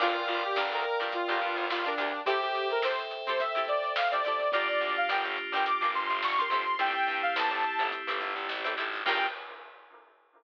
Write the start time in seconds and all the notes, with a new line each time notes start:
0.00 G1 D4 F4 G4 A#4 D5 F5 G5, kick, crash
0.15 closed hi-hat
0.28 G1 F4, closed hi-hat
0.43 G4, closed hi-hat
0.56 G1 D4 F4 G4 A#4, snare
0.72 D2 A#4, closed hi-hat
0.85 closed hi-hat
1.00 G2 D4 F4 G4, closed hi-hat
1.04 A#4
1.12 F4, kick, closed hi-hat
1.28 G1 D4 F4 G4 A#4, kick, closed hi-hat
1.41 G2, kick, snare, closed hi-hat
1.56 G1, snare, closed hi-hat
1.70 G1 F4, snare
1.85 D4 F4 G4 A#4, closed hi-hat
1.98 D2 D4 F4 G4 A#4, snare, closed hi-hat
2.13 snare, closed hi-hat
2.26 C4 E4 G4 A4 C5 E5 G5, kick, closed hi-hat
2.42 G4, closed hi-hat
2.55 closed hi-hat
2.70 A#4, closed hi-hat
2.82 C4 E4 G4 A4 C5, snare
2.99 closed hi-hat
3.11 snare, closed hi-hat
3.27 C4 E4 G4 A4 C5, closed hi-hat
3.40 E5, kick, closed hi-hat
3.55 C4 E4 G4 A4, kick, closed hi-hat
3.67 D5, kick, closed hi-hat
3.83 snare, closed hi-hat
3.96 F5, snare
4.11 C4 E4 G4 A4 D5, closed hi-hat
4.24 C4 E4 G4 D5, snare, closed hi-hat
4.28 A4
4.39 kick, closed hi-hat
4.52 G1 A#3 D4 F4 G4 D5, kick, closed hi-hat
4.56 A#4
4.68 D5, closed hi-hat
4.81 D2, closed hi-hat
4.96 F5, closed hi-hat
5.09 G1 D4 F4 G4 A#4 G5, snare
5.25 G1, closed hi-hat
5.37 closed hi-hat
5.52 G1 D4 F4 G4 G5, snare, closed hi-hat
5.56 A#4
5.66 D6, kick, closed hi-hat
5.81 G1 D4 F4 G4 A#4, kick, closed hi-hat
5.93 G1 C6, kick, closed hi-hat
6.10 G1, closed hi-hat
6.22 G1 C#6, snare
6.38 D4 F4 G4 A#4 C6, snare, closed hi-hat
6.50 G1 C4 E4 G4 C6, snare, closed hi-hat
6.54 A4
6.66 snare, closed hi-hat
6.79 G1 A3 C4 E4 G4 G5, kick, closed hi-hat
6.95 closed hi-hat
7.07 G2, snare, closed hi-hat
7.22 F5, closed hi-hat
7.36 E2 C4 E4 G4 A4 A5, snare
7.51 G1, closed hi-hat
7.63 closed hi-hat
7.79 G1 C4 E4 G4 A4, closed hi-hat
7.92 kick, closed hi-hat
8.07 G1 C4 E4 G4 A4, kick, snare, closed hi-hat
8.20 G1, kick, closed hi-hat
8.36 G1, closed hi-hat
8.49 A1, snare
8.64 C4 E4 G4 A4, closed hi-hat
8.77 G#1 C4 E4 G4 A4, snare, closed hi-hat
8.93 open hi-hat
9.06 G2 A#3 D4 F4 G4 A#4 G5, kick, crash